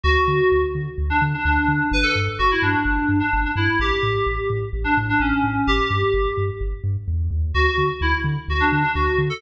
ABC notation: X:1
M:4/4
L:1/16
Q:1/4=128
K:D
V:1 name="Electric Piano 2"
F6 z3 D z D D4 | B A z2 F E D5 D2 D E2 | G6 z3 D z D C4 | G6 z10 |
F F2 z E z3 F D D D F2 z A |]
V:2 name="Synth Bass 2" clef=bass
D,,2 D,2 D,,2 D,2 D,,2 D,2 D,,2 D,2 | G,,,2 G,,2 G,,,2 G,,2 G,,,2 G,,2 G,,,2 G,,2 | A,,,2 A,,2 A,,,2 A,,2 A,,,2 A,,2 A,,,2 A,,2 | G,,,2 G,,2 G,,,2 G,,2 G,,,2 G,,2 E,,2 ^D,,2 |
D,,2 D,2 D,,2 D,2 D,,2 D,2 D,,2 D,2 |]